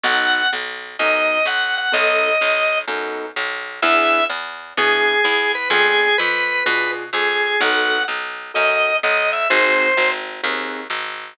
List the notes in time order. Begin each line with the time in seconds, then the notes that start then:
0.03 B1 B3 D#4 F#4 A4 F#5
0.53 B1
0.99 F#2 B3 D#4 F#4 A4 D#5
1.45 B1 F#5
1.78 F#5
1.92 B1 B3 D#4 F#4 A4 D#5
2.41 B1
2.88 F#2 B3 D#4 F#4 A4
3.36 B1
3.82 E2 B3 D4 E4 G#4 E5
4.30 E2
4.77 B2 B3 D4 E4 G#4
5.24 E2 G#4
5.55 B4
5.70 F2 B3 D4 F4 G#4
6.18 F2 B4
6.66 B2 B3 D4 F4 G#4 B4
7.13 F2 G#4
7.60 B1 B3 D#4 F#4 A4 F#5
8.08 B1
8.54 F#2 B3 D#4 F#4 A4 D#5
9.03 B1 D#5
9.33 E5
9.50 G#1 C4 D#4 F#4 G#4 C5
9.97 G#1
10.43 D#2 C4 D#4 F#4 G#4
10.90 G#1